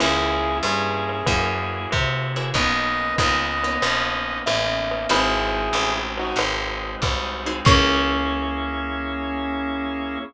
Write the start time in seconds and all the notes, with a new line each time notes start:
0.00 C#2 A#3 C#4 E4 G#4, crash, ride
0.63 G2 E4 G#4, hi-hat pedal, ride
1.09 ride
1.26 F#2 A#3 E4 F#4 G#4, kick, ride
1.91 C3, kick, hi-hat pedal, ride
2.36 A#3 E4 F#4 G#4, ride
2.54 B1 A#3 B3 C#4 D#4 B4 D#5, kick, ride
3.18 C#2 A#3 B3 C#4 D#4 B4 D#5, kick, hi-hat pedal, ride
3.63 A#3 B3 C#4 D#4, ride
3.82 A#1 A#3 B3 C#4 D#4, ride
4.46 A1 E5, hi-hat pedal, ride
4.91 ride
5.09 G#1 G#3 C4 D#4 E4 F#4 G#4 B5, ride
5.73 A1, hi-hat pedal, ride
6.17 D#4 F#4, ride
6.36 G#1, ride
7.02 C2, kick, hi-hat pedal, ride
7.46 C4 D#4 F#4 G#4, ride
7.65 C#2 A#3 C#4 E4 G#4 C#6, kick, crash